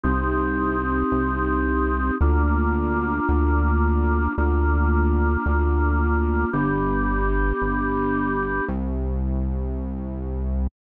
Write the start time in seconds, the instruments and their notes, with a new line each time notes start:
0.03 synth bass 1 C2, drawbar organ C4 D#4 G4
1.12 synth bass 1 C2
2.21 synth bass 1 D2, drawbar organ A#3 D4 F4
3.29 synth bass 1 D2
4.38 synth bass 1 D2, drawbar organ A#3 D4 F4
5.46 synth bass 1 D2
6.53 synth bass 1 G1, drawbar organ B3 D4 G4
7.62 synth bass 1 G1
8.68 synth bass 1 C2